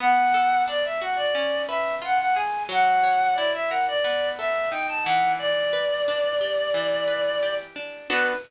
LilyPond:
<<
  \new Staff \with { instrumentName = "Clarinet" } { \time 4/4 \key b \minor \tempo 4 = 89 fis''4 d''16 e''16 fis''16 d''8. e''8 fis''16 fis''16 gis''8 | fis''4 d''16 e''16 fis''16 d''8. e''8 g''16 a''16 fis''8 | d''2.~ d''8 r8 | b'4 r2. | }
  \new Staff \with { instrumentName = "Acoustic Guitar (steel)" } { \time 4/4 \key b \minor b8 a'8 d'8 fis'8 cis'8 b'8 eis'8 gis'8 | fis8 cis''8 e'8 ais'8 b8 a'8 dis'8 e8~ | e8 b'8 d'8 g'8 e8 b'8 g'8 d'8 | <b d' fis' a'>4 r2. | }
>>